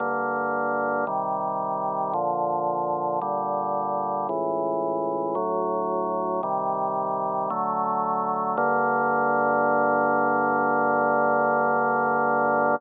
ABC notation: X:1
M:4/4
L:1/8
Q:1/4=56
K:Gm
V:1 name="Drawbar Organ"
[G,,D,B,]2 [C,E,G,]2 [B,,D,F,]2 [B,,D,G,]2 | [^C,,A,,=E,]2 [D,,A,,^F,]2 [=C,_E,G,]2 [D,F,A,]2 | [G,,D,B,]8 |]